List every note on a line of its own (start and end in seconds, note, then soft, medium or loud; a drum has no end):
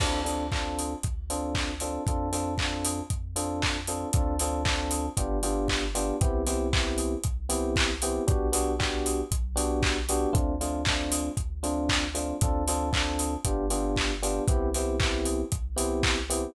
0.00 0.95 D2 medium
0.00 0.20 C4 loud
0.00 0.20 D4 medium
0.00 0.20 F4 medium
0.00 0.20 A4 medium
0.00 kick medium
0.00 crash medium
0.24 0.45 C4 medium
0.24 0.45 D4 medium
0.24 0.45 F4 medium
0.24 0.45 A4 medium
0.24 open hi-hat medium
0.52 0.93 C4 medium
0.52 0.93 D4 medium
0.52 0.93 F4 medium
0.52 0.93 A4 medium
0.52 kick medium
0.52 clap medium
0.79 open hi-hat medium
1.03 1.99 D2 medium
1.03 kick medium
1.03 closed hi-hat medium
1.30 1.71 C4 medium
1.30 1.71 D4 medium
1.30 1.71 F4 medium
1.30 1.71 A4 medium
1.30 open hi-hat medium
1.55 kick medium
1.55 clap medium
1.80 2.02 C4 medium
1.80 2.02 D4 medium
1.80 2.02 F4 medium
1.80 2.02 A4 medium
1.80 open hi-hat medium
2.07 3.02 F2 loud
2.07 2.29 C4 medium
2.07 2.29 D4 medium
2.07 2.29 F4 medium
2.07 2.29 A4 medium
2.07 kick medium
2.07 closed hi-hat medium
2.32 2.53 C4 medium
2.32 2.53 D4 medium
2.32 2.53 F4 medium
2.32 2.53 A4 medium
2.32 open hi-hat medium
2.58 3.00 C4 medium
2.58 3.00 D4 medium
2.58 3.00 F4 medium
2.58 3.00 A4 medium
2.58 kick medium
2.58 clap medium
2.85 open hi-hat medium
3.10 4.06 F2 medium
3.10 kick medium
3.10 closed hi-hat medium
3.36 3.77 C4 medium
3.36 3.77 D4 medium
3.36 3.77 F4 medium
3.36 3.77 A4 medium
3.36 open hi-hat medium
3.62 kick medium
3.62 clap medium
3.87 4.09 C4 medium
3.87 4.09 D4 medium
3.87 4.09 F4 medium
3.87 4.09 A4 medium
3.87 open hi-hat medium
4.13 5.09 D2 loud
4.13 4.35 C4 medium
4.13 4.35 D4 medium
4.13 4.35 F4 medium
4.13 4.35 A4 medium
4.13 kick medium
4.13 closed hi-hat medium
4.39 4.62 C4 medium
4.39 4.62 D4 medium
4.39 4.62 F4 medium
4.39 4.62 A4 medium
4.39 open hi-hat medium
4.65 5.06 C4 medium
4.65 5.06 D4 medium
4.65 5.06 F4 medium
4.65 5.06 A4 medium
4.65 kick medium
4.65 clap medium
4.91 open hi-hat medium
5.17 6.12 G1 loud
5.17 5.38 B3 medium
5.17 5.38 D4 medium
5.17 5.38 F4 medium
5.17 5.38 G4 medium
5.17 kick medium
5.17 closed hi-hat loud
5.43 5.84 B3 medium
5.43 5.84 D4 medium
5.43 5.84 F4 medium
5.43 5.84 G4 medium
5.43 open hi-hat medium
5.68 kick medium
5.68 clap medium
5.95 6.16 B3 medium
5.95 6.16 D4 medium
5.95 6.16 F4 medium
5.95 6.16 G4 medium
5.95 open hi-hat medium
6.21 7.16 C2 loud
6.21 6.42 B3 loud
6.21 6.42 C4 medium
6.21 6.42 E4 medium
6.21 6.42 G4 loud
6.21 kick medium
6.21 closed hi-hat medium
6.47 6.67 B3 medium
6.47 6.67 C4 medium
6.47 6.67 E4 medium
6.47 6.67 G4 medium
6.47 open hi-hat medium
6.73 7.14 B3 medium
6.73 7.14 C4 medium
6.73 7.14 E4 medium
6.73 7.14 G4 medium
6.73 kick medium
6.73 clap medium
6.98 open hi-hat medium
7.23 8.19 C2 loud
7.23 kick medium
7.23 closed hi-hat medium
7.49 7.91 B3 medium
7.49 7.91 C4 medium
7.49 7.91 E4 medium
7.49 7.91 G4 medium
7.49 open hi-hat medium
7.76 kick medium
7.76 clap loud
8.02 8.23 B3 medium
8.02 8.23 C4 medium
8.02 8.23 E4 medium
8.02 8.23 G4 medium
8.02 open hi-hat medium
8.27 9.23 B1 loud
8.27 8.48 B3 medium
8.27 8.48 D4 medium
8.27 8.48 F#4 medium
8.27 8.48 G4 loud
8.27 kick medium
8.27 closed hi-hat medium
8.52 8.73 B3 medium
8.52 8.73 D4 medium
8.52 8.73 F#4 medium
8.52 8.73 G4 medium
8.52 open hi-hat medium
8.79 9.21 B3 medium
8.79 9.21 D4 medium
8.79 9.21 F#4 medium
8.79 9.21 G4 medium
8.79 kick medium
8.79 clap medium
9.06 open hi-hat medium
9.31 10.26 B1 loud
9.31 kick medium
9.31 closed hi-hat medium
9.56 9.97 B3 medium
9.56 9.97 D4 medium
9.56 9.97 F#4 medium
9.56 9.97 G4 medium
9.56 open hi-hat medium
9.83 kick medium
9.83 clap medium
10.09 10.30 B3 medium
10.09 10.30 D4 medium
10.09 10.30 F#4 medium
10.09 10.30 G4 medium
10.09 open hi-hat medium
10.33 11.30 D2 loud
10.33 10.54 A3 loud
10.33 10.54 C4 loud
10.33 10.54 D4 medium
10.33 10.54 F4 medium
10.33 kick medium
10.33 closed hi-hat medium
10.61 10.81 A3 medium
10.61 10.81 C4 medium
10.61 10.81 D4 medium
10.61 10.81 F4 medium
10.61 open hi-hat medium
10.85 11.29 A3 medium
10.85 11.29 C4 medium
10.85 11.29 D4 medium
10.85 11.29 F4 medium
10.85 kick medium
10.85 clap loud
11.12 open hi-hat medium
11.37 12.33 D2 loud
11.37 kick medium
11.37 closed hi-hat medium
11.63 12.04 A3 medium
11.63 12.04 C4 medium
11.63 12.04 D4 medium
11.63 12.04 F4 medium
11.63 open hi-hat medium
11.89 kick medium
11.89 clap loud
12.14 12.35 A3 medium
12.14 12.35 C4 medium
12.14 12.35 D4 medium
12.14 12.35 F4 medium
12.14 open hi-hat medium
12.41 13.37 D2 loud
12.41 12.63 C4 medium
12.41 12.63 D4 medium
12.41 12.63 F4 medium
12.41 12.63 A4 medium
12.41 kick medium
12.41 closed hi-hat medium
12.68 12.89 C4 medium
12.68 12.89 D4 medium
12.68 12.89 F4 medium
12.68 12.89 A4 medium
12.68 open hi-hat medium
12.93 13.34 C4 medium
12.93 13.34 D4 medium
12.93 13.34 F4 medium
12.93 13.34 A4 medium
12.93 kick medium
12.93 clap medium
13.19 open hi-hat medium
13.45 14.40 G1 loud
13.45 13.65 B3 medium
13.45 13.65 D4 medium
13.45 13.65 F4 medium
13.45 13.65 G4 medium
13.45 kick medium
13.45 closed hi-hat loud
13.70 14.12 B3 medium
13.70 14.12 D4 medium
13.70 14.12 F4 medium
13.70 14.12 G4 medium
13.70 open hi-hat medium
13.96 kick medium
13.96 clap medium
14.22 14.43 B3 medium
14.22 14.43 D4 medium
14.22 14.43 F4 medium
14.22 14.43 G4 medium
14.22 open hi-hat medium
14.48 15.43 C2 loud
14.48 14.69 B3 loud
14.48 14.69 C4 medium
14.48 14.69 E4 medium
14.48 14.69 G4 loud
14.48 kick medium
14.48 closed hi-hat medium
14.74 14.96 B3 medium
14.74 14.96 C4 medium
14.74 14.96 E4 medium
14.74 14.96 G4 medium
14.74 open hi-hat medium
15.00 15.41 B3 medium
15.00 15.41 C4 medium
15.00 15.41 E4 medium
15.00 15.41 G4 medium
15.00 kick medium
15.00 clap medium
15.25 open hi-hat medium
15.52 16.47 C2 loud
15.52 kick medium
15.52 closed hi-hat medium
15.76 16.18 B3 medium
15.76 16.18 C4 medium
15.76 16.18 E4 medium
15.76 16.18 G4 medium
15.76 open hi-hat medium
16.03 kick medium
16.03 clap loud
16.30 16.50 B3 medium
16.30 16.50 C4 medium
16.30 16.50 E4 medium
16.30 16.50 G4 medium
16.30 open hi-hat medium